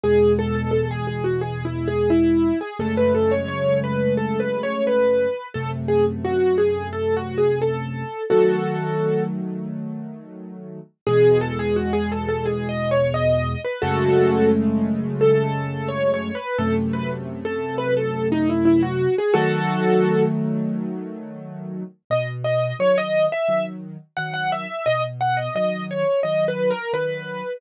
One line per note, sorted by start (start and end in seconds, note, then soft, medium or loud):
0.04 2.52 E2 medium
0.04 2.52 B2 medium
0.04 2.52 G#3 medium
0.04 0.33 G#4 loud
0.39 0.55 A4 loud
0.55 0.71 A4 medium
0.71 0.88 A4 medium
0.91 1.07 G#4 medium
1.07 1.24 G#4 medium
1.24 1.41 F#4 medium
1.41 1.63 G#4 medium
1.65 1.87 E4 medium
1.88 2.09 G#4 medium
2.10 2.59 E4 loud
2.61 2.77 G#4 medium
2.79 5.28 F#2 medium
2.79 5.28 C#3 medium
2.79 5.28 G#3 medium
2.79 5.28 A3 loud
2.79 2.96 A4 medium
2.97 3.14 B4 medium
3.15 3.31 A4 medium
3.31 3.48 C#5 medium
3.48 3.79 C#5 medium
3.84 4.14 B4 medium
4.17 4.39 A4 medium
4.40 4.62 B4 medium
4.63 4.85 C#5 loud
4.87 5.46 B4 medium
5.54 8.04 F#2 medium
5.54 8.04 C3 medium
5.54 8.04 A3 medium
5.54 5.71 A4 medium
5.88 6.05 G#4 medium
6.25 6.58 F#4 loud
6.58 6.88 G#4 medium
6.93 7.15 A4 medium
7.17 7.39 F#4 medium
7.38 7.60 G#4 medium
7.62 8.24 A4 medium
8.30 10.79 D#3 medium
8.30 10.79 F#3 medium
8.30 10.79 A3 medium
8.30 9.23 F#4 medium
8.30 9.23 A4 medium
11.07 13.55 E2 loud
11.07 13.55 B2 loud
11.07 13.55 G#3 loud
11.07 11.39 G#4 loud
11.41 11.58 A4 loud
11.59 11.76 G#4 loud
11.76 11.93 F#4 medium
11.93 12.09 G#4 loud
12.12 12.28 A4 medium
12.29 12.45 A4 medium
12.46 12.67 G#4 medium
12.69 12.91 D#5 medium
12.91 13.13 C#5 loud
13.14 13.60 D#5 loud
13.65 13.81 B4 medium
13.82 16.31 F#2 loud
13.82 16.31 C#3 loud
13.82 16.31 G#3 loud
13.82 16.31 A3 loud
13.82 14.49 F#4 loud
13.82 14.49 A4 loud
15.21 15.88 A4 loud
15.89 16.10 C#5 loud
16.14 16.36 C#5 medium
16.35 16.57 B4 loud
16.58 19.07 F#2 loud
16.58 19.07 C3 loud
16.58 19.07 A3 loud
16.58 16.75 A4 loud
16.93 17.10 B4 medium
17.45 17.76 A4 medium
17.78 17.94 B4 loud
17.97 18.27 A4 medium
18.32 18.48 D#4 loud
18.49 18.65 E4 medium
18.65 18.82 E4 loud
18.83 19.16 F#4 loud
19.18 19.35 G#4 medium
19.34 21.83 D#3 loud
19.34 21.83 F#3 loud
19.34 21.83 A3 loud
19.34 20.23 F#4 loud
19.34 20.23 A4 loud
22.10 22.72 B2 medium
22.10 22.27 D#5 loud
22.44 22.75 D#5 medium
22.79 23.28 D#3 medium
22.79 23.28 F#3 medium
22.79 22.96 C#5 loud
22.98 23.25 D#5 loud
23.32 23.65 E5 loud
23.48 23.97 D#3 medium
23.48 23.97 F#3 medium
24.17 24.66 D#3 medium
24.17 24.66 F#3 medium
24.17 24.33 F#5 loud
24.34 24.50 F#5 loud
24.52 24.85 E5 medium
24.86 25.48 B2 medium
24.86 25.02 D#5 loud
25.21 25.37 F#5 loud
25.37 25.53 D#5 medium
25.55 26.04 D#3 medium
25.55 26.04 F#3 medium
25.55 25.84 D#5 medium
25.91 26.20 C#5 medium
26.23 26.72 D#3 medium
26.23 26.72 F#3 medium
26.23 26.45 D#5 medium
26.48 26.70 B4 medium
26.71 26.92 A#4 loud
26.93 27.42 D#3 medium
26.93 27.42 F#3 medium
26.93 27.57 B4 loud